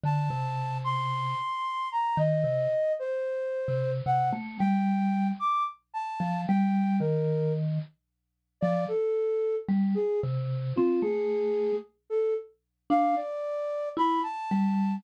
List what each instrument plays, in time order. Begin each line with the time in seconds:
0.03 vibraphone D3, flute A5
0.30 vibraphone C3
0.84 flute C6
1.92 flute A#5
2.17 vibraphone D#3, flute D#5
2.44 vibraphone C3
2.99 flute C5
3.68 vibraphone C3
4.06 vibraphone C3, flute F#5
4.33 vibraphone A3
4.59 vibraphone G3, flute G5
5.40 flute D6
5.94 flute A5
6.20 vibraphone F3
6.48 vibraphone G3, flute G5
7.00 vibraphone D#3, flute A#4
8.61 vibraphone F3, flute D5
8.88 flute A4
9.69 vibraphone G3
9.95 flute G#4
10.23 vibraphone C3
10.76 vibraphone C4, flute F4
11.02 vibraphone A3, flute G#4
12.10 flute A4
12.90 vibraphone D4, flute F5
13.16 flute D5
13.97 vibraphone E4, flute B5
14.23 flute A5
14.51 vibraphone G3